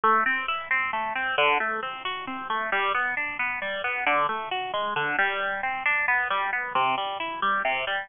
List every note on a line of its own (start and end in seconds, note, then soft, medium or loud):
0.04 0.24 A3 medium
0.26 0.46 C4 medium
0.48 0.68 E4 medium
0.71 0.91 C4 medium
0.93 1.13 A3 medium
1.15 1.36 C4 medium
1.38 1.58 D3 loud
1.60 1.80 A3 medium
1.83 2.03 C4 medium
2.05 2.25 F#4 medium
2.27 2.48 C4 medium
2.50 2.70 A3 medium
2.72 2.92 G3 loud
2.95 3.15 B3 medium
3.17 3.37 D4 medium
3.39 3.60 B3 medium
3.62 3.82 G3 medium
3.84 4.04 B3 medium
4.07 4.27 D3 loud
4.29 4.49 A3 medium
4.51 4.71 F#4 medium
4.74 4.94 G#3 medium
4.96 5.16 D3 loud
5.19 5.61 G3 loud
5.63 5.83 C4 medium
5.86 6.06 D4 medium
6.08 6.28 B3 medium
6.30 6.51 G3 medium
6.53 6.73 B3 medium
6.75 6.95 C3 loud
6.98 7.18 G3 medium
7.20 7.40 E4 medium
7.42 7.62 G3 medium
7.65 7.85 C3 loud
7.87 8.07 G3 medium